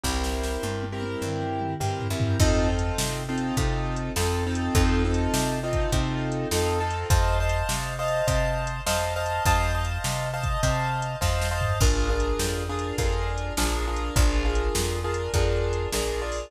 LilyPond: <<
  \new Staff \with { instrumentName = "Acoustic Grand Piano" } { \time 4/4 \key f \major \tempo 4 = 102 <c' e' g' bes'>4. <c' e' g' bes'>4. <c' e' g' bes'>8 <c' e' g' bes'>8 | <c' ees' f' a'>8 <c' ees' f' a'>4 <c' ees' f' a'>8 <c' ees' f' a'>4 <c' ees' f' a'>8 <c' ees' f' a'>8 | <c' ees' f' a'>8 <c' ees' f' a'>4 <c' ees' f' a'>8 <c' ees' f' a'>4 <c' ees' f' a'>8 <c' ees' f' a'>8 | <c'' ees'' f'' a''>8 <c'' ees'' f'' a''>4 <c'' ees'' f'' a''>8 <c'' ees'' f'' a''>4 <c'' ees'' f'' a''>8 <c'' ees'' f'' a''>8 |
<c'' ees'' f'' a''>8 <c'' ees'' f'' a''>4 <c'' ees'' f'' a''>8 <c'' ees'' f'' a''>4 <c'' ees'' f'' a''>8 <c'' ees'' f'' a''>8 | <d' f' aes' bes'>8 <d' f' aes' bes'>4 <d' f' aes' bes'>8 <d' f' aes' bes'>4 <d' f' aes' bes'>8 <d' f' aes' bes'>8 | <d' f' aes' bes'>8 <d' f' aes' bes'>4 <d' f' aes' bes'>8 <d' f' aes' bes'>4 <d' f' aes' bes'>8 <d' f' aes' bes'>8 | }
  \new Staff \with { instrumentName = "Electric Bass (finger)" } { \clef bass \time 4/4 \key f \major c,4 g,4 g,4 g,8 ges,8 | f,4 c4 c4 f,4 | f,4 c4 c4 f,4 | f,4 c4 c4 f,4 |
f,4 c4 c4 f,4 | bes,,4 f,4 f,4 bes,,4 | bes,,4 f,4 f,4 bes,,4 | }
  \new DrumStaff \with { instrumentName = "Drums" } \drummode { \time 4/4 \tuplet 3/2 { <bd sn>8 sn8 sn8 tommh8 tommh8 tommh8 toml8 toml8 toml8 tomfh8 tomfh8 tomfh8 } | \tuplet 3/2 { <cymc bd>8 r8 hh8 sn8 r8 hh8 <hh bd>8 r8 hh8 sn8 r8 hh8 } | \tuplet 3/2 { <hh bd>8 r8 hh8 sn8 r8 <hh bd>8 <hh bd>8 r8 hh8 sn8 r8 hh8 } | \tuplet 3/2 { <hh bd>8 r8 hh8 sn8 r8 hh8 <hh bd>8 r8 hh8 sn8 r8 hh8 } |
\tuplet 3/2 { <hh bd>8 r8 hh8 sn8 r8 <hh bd>8 <hh bd>8 r8 hh8 <bd sn>8 sn8 tomfh8 } | \tuplet 3/2 { <cymc bd>8 r8 hh8 sn8 r8 hh8 <hh bd>8 r8 hh8 sn8 r8 hh8 } | \tuplet 3/2 { <hh bd>8 r8 hh8 sn8 r8 hh8 <hh bd>8 r8 hh8 sn8 r8 hho8 } | }
>>